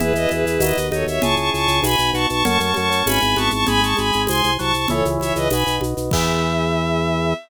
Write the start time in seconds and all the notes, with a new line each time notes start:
0.00 E2 B3 E4 G#4 B4, low conga, shaker
0.14 E2 B4 D#5, shaker
0.29 E2 G#4 B4, high conga, shaker
0.46 E2, shaker
0.60 D#2 B3 D#4 F#4 B4 D#5, tambourine, high conga, shaker
0.77 D#2, shaker
0.92 D#2 D#4 A4 C#5, high conga, shaker
1.07 D#2 C#5 E5, shaker
1.22 C#2 C#4 E4 G#4 A5 C#6, low conga, shaker
1.36 C#2 A5 C#6, shaker
1.53 C#2 A5 C#6, shaker
1.68 C#2, shaker
1.82 B1 B3 D#4 F#4 G#5 B5, tambourine, high conga, shaker
1.98 B1, shaker
2.13 B1 F#4 A5 C#6, shaker
2.29 B1 A5 C#6, shaker
2.45 F#2 A3 C#4 F#4 A5 C#6, low conga, shaker
2.60 F#2 A5 C#6, shaker
2.74 F#2 A5 C#6, high conga, shaker
2.90 F#2, shaker
3.06 G#1 G#3 B3 E4 G#5 B5, tambourine, high conga, shaker
3.21 G#1, shaker
3.36 G#1 B3 A5 C#6, high conga, shaker
3.50 G#1 A5 C#6, shaker
3.67 G#1 G#3 G#5 B5, low conga, shaker
3.81 G#1 A5 C#6, shaker
3.97 G#1 G#5 B5, high conga, shaker
4.12 G#1, shaker
4.27 C2 G#5 C6, tambourine, high conga, shaker
4.43 C2, shaker
4.59 C2 F#3 A5 C#6, shaker
4.74 C2 A5 C#6, shaker
4.88 C#2 E3 G#4 A4 C#5 E5, low conga, shaker
5.05 C#2, shaker
5.20 C#2 C#5 E5, high conga, shaker
5.36 C#2 B4 D#5, shaker
5.50 B1 F#4 B4 D#5 G#5 B5, tambourine, high conga, shaker
5.67 B1, shaker
5.81 B1, high conga, shaker
5.97 B1, shaker
6.11 E2 E3 B3 E4 G#4 E5, kick, crash